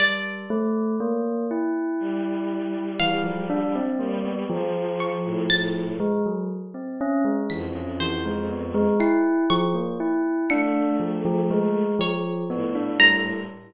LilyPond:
<<
  \new Staff \with { instrumentName = "Tubular Bells" } { \time 9/8 \tempo 4. = 40 g8 a8 bes8 e'4. e16 f16 d'16 c'16 bes16 b16 | f4. aes16 ges16 r16 c'16 des'16 aes16 e16 des'16 e16 aes16 b16 aes16 | e'8 f16 bes16 e'8 d'8 f16 f16 aes8 f8 b16 d'16 g8 | }
  \new Staff \with { instrumentName = "Violin" } { \time 9/8 r2 g2 g8 | f8. a,16 a,8 r4. f,4. | r4. a4. r8 a,4 | }
  \new Staff \with { instrumentName = "Orchestral Harp" } { \time 9/8 d''2. f''4. | r8 des'''8 a'''8 r4. b'''8 c''4 | c''''8 des'''4 des''''4. des''4 bes''8 | }
>>